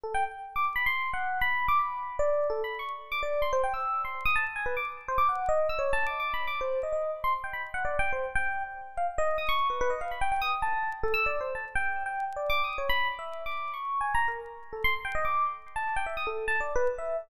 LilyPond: \new Staff { \time 6/4 \tempo 4 = 146 a'16 g''16 r8. d'''16 r16 b''16 \tuplet 3/2 { c'''4 fis''4 b''4 } d'''16 b''4 d''8. | \tuplet 3/2 { a'8 b''8 cis'''8 } r8 d'''16 d''8 c'''16 c''16 g''16 e'''8. c'''8 dis'''16 a''16 r16 gis''16 b'16 d'''16 r16 | r16 c''16 d'''16 fis''8 dis''8 e'''16 \tuplet 3/2 { cis''8 a''8 d'''8 d'''8 b''8 d'''8 } c''8 dis''16 dis''8 r16 c'''16 r16 | g''16 b''16 r16 fis''16 \tuplet 3/2 { d''8 g''8 c''8 } r16 g''8. r8. f''16 r16 dis''8 dis'''16 cis'''8 b'16 b'16 |
dis''16 f''16 b''16 g''16 g''16 dis'''16 r16 a''8. r16 a'16 \tuplet 3/2 { e'''8 d''8 c''8 } a''16 r16 g''8. g''8 r16 | \tuplet 3/2 { d''8 d'''8 dis'''8 } cis''16 b''8 r16 \tuplet 3/2 { e''4 d'''4 cis'''4 gis''8 ais''8 ais'8 } r8. a'16 | c'''16 r16 g''16 dis''16 d'''8 r8. a''8 g''16 e''16 dis'''16 a'8 \tuplet 3/2 { a''8 d''8 b'8 } r16 e''8 r16 | }